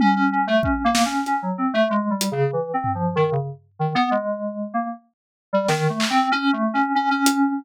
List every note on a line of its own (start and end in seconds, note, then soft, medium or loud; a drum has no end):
0.00 0.14 C#4 loud
0.00 high tom loud
0.16 0.30 C#4 medium
0.32 0.46 C#4 medium
0.47 0.62 A3 loud
0.63 0.82 C#4 medium
0.63 kick medium
0.84 1.03 A#3 medium
0.95 snare loud
1.05 1.24 C#4 medium
1.26 1.41 C#4 medium
1.26 closed hi-hat medium
1.42 1.56 F#3 medium
1.58 1.72 C4 medium
1.74 1.88 A3 loud
1.90 2.09 G#3 medium
2.10 2.29 G3 medium
2.21 closed hi-hat loud
2.32 2.51 C#3 medium
2.53 2.72 E3 medium
2.74 2.93 C4 medium
2.84 floor tom medium
2.95 3.14 F3 medium
3.16 3.30 D#3 loud
3.32 3.46 C#3 medium
3.79 3.94 D#3 medium
3.95 4.09 B3 loud
4.11 4.68 G#3 medium
4.74 4.88 A#3 medium
5.53 5.67 G3 medium
5.68 5.87 D#3 loud
5.68 snare medium
5.89 6.08 A3 medium
6.00 clap loud
6.10 6.29 C4 loud
6.32 6.51 C#4 loud
6.53 6.72 A3 medium
6.74 6.93 C#4 medium
6.95 7.09 C#4 medium
7.11 7.53 C#4 medium
7.26 closed hi-hat loud